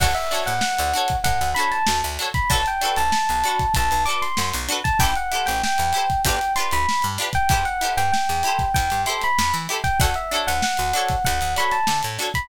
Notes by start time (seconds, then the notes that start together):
0.00 D2 D4 F#4 A4 C#5 F#5, kick, crash
0.15 E5, closed hi-hat
0.31 D4 F#4 A4 C#5, closed hi-hat
0.46 A2 F#5, closed hi-hat
0.61 F#5, snare
0.79 D2, closed hi-hat
0.93 D4 F#4 A4 C#5, closed hi-hat
1.08 kick, closed hi-hat
1.24 A2 F#5, kick, closed hi-hat
1.41 D2, snare, closed hi-hat
1.55 D4 F#4 A4 B5, closed hi-hat
1.60 C#5
1.71 A5, closed hi-hat
1.87 D2, snare
2.02 D2, snare, closed hi-hat
2.19 D4 F#4 A4 C#5, closed hi-hat
2.34 B5, kick, closed hi-hat
2.50 B1 D4 F#4 A4 B4 A5, kick, closed hi-hat
2.66 G5, closed hi-hat
2.81 D4 F#4 A4 B4, closed hi-hat
2.96 B1 A5, closed hi-hat
3.12 A5, snare
3.29 B1, closed hi-hat
3.44 D4 F#4 A4, closed hi-hat
3.48 B4
3.59 kick, closed hi-hat
3.74 B1 A5, kick, closed hi-hat
3.91 B1, closed hi-hat
4.05 D4 F#4 A4 D6, closed hi-hat
4.10 B4
4.22 C6, closed hi-hat
4.37 F#2, snare
4.54 B1, closed hi-hat
4.68 D4 F#4 A4 B4, closed hi-hat
4.84 A5, kick, closed hi-hat
4.99 A1 E4 G4 A4 G5, kick, closed hi-hat
5.04 C5
5.15 F#5, closed hi-hat
5.32 E4 G4 A4 C5, closed hi-hat
5.46 A1 G5, snare, closed hi-hat
5.63 G5, snare
5.78 E2, snare, closed hi-hat
5.93 E4 G4 A4, closed hi-hat
5.97 C5
6.10 kick, closed hi-hat
6.25 G1 D4 F4 G4 B4 G5, kick, closed hi-hat
6.41 closed hi-hat
6.56 D4 F4 G4 C6, closed hi-hat
6.60 B4
6.71 D2 B5, closed hi-hat
6.89 snare
7.02 G2, closed hi-hat
7.18 D4 F4 G4 B4, snare, closed hi-hat
7.33 G5, kick, closed hi-hat
7.49 E2 E4 G4 A4 G5, kick, closed hi-hat
7.54 C5
7.65 F#5, closed hi-hat
7.81 E4 G4 A4 C5, closed hi-hat
7.97 G2 G5, closed hi-hat
8.12 G5, snare
8.29 E2, closed hi-hat
8.43 E4 G4 A4, closed hi-hat
8.48 C5
8.59 kick, snare, closed hi-hat
8.74 E2 G5, kick, closed hi-hat
8.90 G2, closed hi-hat
9.06 E4 G4 A4 C5 C6, closed hi-hat
9.21 B5, snare, closed hi-hat
9.38 E2, snare
9.54 E3, closed hi-hat
9.69 E4 G4 A4 C5, closed hi-hat
9.84 G5, kick, closed hi-hat
10.00 D2 D4 F#4 A4 C#5 F#5, kick, closed hi-hat
10.14 E5, closed hi-hat
10.31 D4 F#4 A4 C#5, closed hi-hat
10.47 D2 F#5, closed hi-hat
10.62 F#5, snare
10.77 D2, closed hi-hat
10.93 D4 F#4 A4 C#5, closed hi-hat
11.08 kick, snare, closed hi-hat
11.24 D2 F#5, kick, closed hi-hat
11.41 D2, closed hi-hat
11.56 D4 F#4 A4 C#5 B5, snare, closed hi-hat
11.71 A5, snare, closed hi-hat
11.87 D3, snare
12.03 A2, closed hi-hat
12.18 D4 F#4 A4, snare, closed hi-hat
12.22 C#5
12.34 B5, kick, closed hi-hat